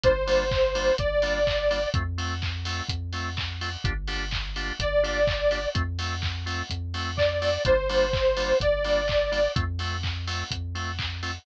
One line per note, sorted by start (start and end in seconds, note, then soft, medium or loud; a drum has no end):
0.03 0.91 G1 medium
0.03 0.12 G3 medium
0.03 0.12 A#3 medium
0.03 0.12 D4 medium
0.03 0.12 F4 medium
0.03 0.96 C5 medium
0.03 kick loud
0.03 closed hi-hat loud
0.27 0.44 G3 medium
0.27 0.44 A#3 medium
0.27 0.44 D4 medium
0.27 0.44 F4 medium
0.27 open hi-hat medium
0.51 kick loud
0.51 clap loud
0.75 0.92 G3 medium
0.75 0.92 A#3 medium
0.75 0.92 D4 medium
0.75 0.92 F4 medium
0.75 open hi-hat medium
0.98 1.87 G1 medium
0.98 1.89 D5 medium
0.98 kick loud
0.98 closed hi-hat loud
1.22 1.39 G3 medium
1.22 1.39 A#3 medium
1.22 1.39 D4 medium
1.22 1.39 F4 medium
1.22 open hi-hat medium
1.47 kick medium
1.47 clap loud
1.71 1.79 G3 medium
1.71 1.79 A#3 medium
1.71 1.79 D4 medium
1.71 1.79 F4 medium
1.71 open hi-hat medium
1.94 2.82 F2 medium
1.94 2.03 A3 medium
1.94 2.03 C4 medium
1.94 2.03 F4 medium
1.94 kick loud
1.94 closed hi-hat loud
2.18 2.34 A3 medium
2.18 2.34 C4 medium
2.18 2.34 F4 medium
2.18 open hi-hat medium
2.42 kick medium
2.42 clap loud
2.65 2.83 A3 medium
2.65 2.83 C4 medium
2.65 2.83 F4 medium
2.65 open hi-hat medium
2.89 3.77 F2 medium
2.89 kick medium
2.89 closed hi-hat loud
3.13 3.30 A3 medium
3.13 3.30 C4 medium
3.13 3.30 F4 medium
3.13 open hi-hat medium
3.37 kick medium
3.37 clap loud
3.61 3.69 A3 medium
3.61 3.69 C4 medium
3.61 3.69 F4 medium
3.61 open hi-hat medium
3.84 4.72 G1 loud
3.84 3.93 A#3 medium
3.84 3.93 D4 medium
3.84 3.93 F4 medium
3.84 3.93 G4 medium
3.84 kick loud
3.84 closed hi-hat loud
4.07 4.25 A#3 medium
4.07 4.25 D4 medium
4.07 4.25 F4 medium
4.07 4.25 G4 medium
4.07 open hi-hat medium
4.31 kick medium
4.31 clap loud
4.56 4.73 A#3 medium
4.56 4.73 D4 medium
4.56 4.73 F4 medium
4.56 4.73 G4 medium
4.56 open hi-hat medium
4.79 5.67 G1 medium
4.79 5.69 D5 medium
4.79 kick medium
4.79 closed hi-hat loud
5.03 5.20 A#3 medium
5.03 5.20 D4 medium
5.03 5.20 F4 medium
5.03 5.20 G4 medium
5.03 open hi-hat medium
5.27 kick loud
5.27 clap loud
5.51 5.59 A#3 medium
5.51 5.59 D4 medium
5.51 5.59 F4 medium
5.51 5.59 G4 medium
5.51 open hi-hat medium
5.75 6.63 F2 medium
5.75 5.83 A3 medium
5.75 5.83 C4 medium
5.75 5.83 F4 medium
5.75 kick loud
5.75 closed hi-hat loud
5.99 6.16 A3 medium
5.99 6.16 C4 medium
5.99 6.16 F4 medium
5.99 open hi-hat medium
6.22 kick medium
6.22 clap loud
6.46 6.63 A3 medium
6.46 6.63 C4 medium
6.46 6.63 F4 medium
6.46 open hi-hat medium
6.70 7.58 F2 medium
6.70 kick medium
6.70 closed hi-hat loud
6.94 7.11 A3 medium
6.94 7.11 C4 medium
6.94 7.11 F4 medium
6.94 open hi-hat medium
7.17 7.63 D5 medium
7.17 kick medium
7.17 clap loud
7.42 7.50 A3 medium
7.42 7.50 C4 medium
7.42 7.50 F4 medium
7.42 open hi-hat medium
7.65 8.53 G1 medium
7.65 7.74 G3 medium
7.65 7.74 A#3 medium
7.65 7.74 D4 medium
7.65 7.74 F4 medium
7.65 8.58 C5 medium
7.65 kick loud
7.65 closed hi-hat loud
7.89 8.06 G3 medium
7.89 8.06 A#3 medium
7.89 8.06 D4 medium
7.89 8.06 F4 medium
7.89 open hi-hat medium
8.13 kick loud
8.13 clap loud
8.37 8.53 G3 medium
8.37 8.53 A#3 medium
8.37 8.53 D4 medium
8.37 8.53 F4 medium
8.37 open hi-hat medium
8.60 9.48 G1 medium
8.60 9.51 D5 medium
8.60 kick loud
8.60 closed hi-hat loud
8.84 9.01 G3 medium
8.84 9.01 A#3 medium
8.84 9.01 D4 medium
8.84 9.01 F4 medium
8.84 open hi-hat medium
9.08 kick medium
9.08 clap loud
9.32 9.40 G3 medium
9.32 9.40 A#3 medium
9.32 9.40 D4 medium
9.32 9.40 F4 medium
9.32 open hi-hat medium
9.56 10.44 F2 medium
9.56 9.64 A3 medium
9.56 9.64 C4 medium
9.56 9.64 F4 medium
9.56 kick loud
9.56 closed hi-hat loud
9.79 9.97 A3 medium
9.79 9.97 C4 medium
9.79 9.97 F4 medium
9.79 open hi-hat medium
10.03 kick medium
10.03 clap loud
10.27 10.44 A3 medium
10.27 10.44 C4 medium
10.27 10.44 F4 medium
10.27 open hi-hat medium
10.51 11.39 F2 medium
10.51 kick medium
10.51 closed hi-hat loud
10.75 10.92 A3 medium
10.75 10.92 C4 medium
10.75 10.92 F4 medium
10.75 open hi-hat medium
10.99 kick medium
10.99 clap loud
11.23 11.31 A3 medium
11.23 11.31 C4 medium
11.23 11.31 F4 medium
11.23 open hi-hat medium